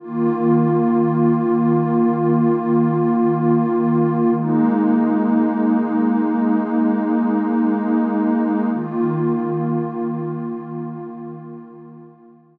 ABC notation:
X:1
M:4/4
L:1/8
Q:1/4=55
K:Ebmix
V:1 name="Pad 2 (warm)"
[E,B,F]8 | [A,B,E]8 | [E,B,F]8 |]